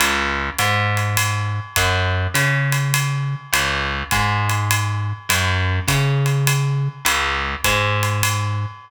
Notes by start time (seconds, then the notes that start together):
0.00 C#2, ride
0.58 G#2, hi-hat pedal, ride
0.97 ride
1.17 ride
1.76 F#2, kick, ride
2.34 C#3, hi-hat pedal, ride
2.72 ride
2.94 ride
3.53 C#2, ride
4.11 G#2, kick, hi-hat pedal, ride
4.50 ride
4.71 ride
5.29 F#2, ride
5.88 C#3, kick, hi-hat pedal, ride
6.26 ride
6.47 ride
7.05 C#2, ride
7.64 G#2, kick, hi-hat pedal, ride
8.03 ride
8.23 ride